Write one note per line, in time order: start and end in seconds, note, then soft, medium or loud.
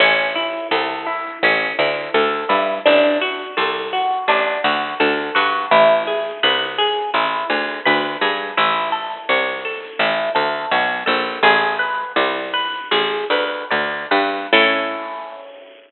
0.00 0.60 A1 loud
0.00 0.32 C#4 loud
0.35 0.68 E4 medium
0.71 1.32 C2 loud
0.71 1.03 A4 medium
1.06 1.39 E4 medium
1.43 1.73 A1 loud
1.43 1.76 C#4 loud
1.79 2.09 D2 loud
1.79 2.11 E4 medium
2.14 2.45 D2 loud
2.14 2.46 A4 medium
2.49 2.80 G2 medium
2.49 2.81 E4 medium
2.86 3.47 A1 loud
2.86 3.18 D4 loud
3.21 3.53 F#4 medium
3.57 4.18 C2 medium
3.57 3.89 A4 medium
3.93 4.25 F#4 medium
4.28 4.58 A1 loud
4.28 4.61 D4 loud
4.64 4.94 D2 medium
4.64 4.96 F#4 medium
5.00 5.31 D2 loud
5.00 5.32 A4 medium
5.35 5.66 G2 loud
5.35 5.67 F#4 medium
5.71 6.32 A1 loud
5.71 6.03 E4 loud
6.07 6.39 G#4 medium
6.43 7.04 C2 loud
6.43 6.75 B4 loud
6.78 7.10 G#4 medium
7.14 7.44 A1 medium
7.14 7.47 E4 loud
7.50 7.80 D2 medium
7.50 7.82 G#4 medium
7.85 8.17 D2 loud
7.85 8.18 B4 medium
8.21 8.52 G2 medium
8.21 8.54 G#4 medium
8.57 9.18 A1 loud
8.57 8.89 E4 loud
8.92 9.24 A4 medium
9.29 9.90 C2 loud
9.29 9.61 C#5 medium
9.65 9.97 A4 medium
9.99 10.30 A1 loud
9.99 10.32 E4 medium
10.35 10.66 D2 medium
10.35 10.67 A4 medium
10.71 11.04 B1 loud
10.71 11.04 C#5 medium
11.06 11.39 A#1 loud
11.06 11.38 A4 medium
11.43 12.04 A1 loud
11.43 11.76 G#4 loud
11.79 12.12 B4 medium
12.16 12.80 C2 loud
12.16 12.50 D5 medium
12.54 12.88 B4 loud
12.91 13.24 A1 medium
12.91 13.27 G#4 loud
13.30 13.64 D2 medium
13.30 13.67 B4 loud
13.71 14.06 D2 loud
13.71 14.07 D5 medium
14.11 14.47 G2 loud
14.11 14.48 B4 medium
14.53 15.91 A2 loud
14.53 15.91 C#4 loud
14.53 15.91 E4 loud
14.53 15.91 A4 loud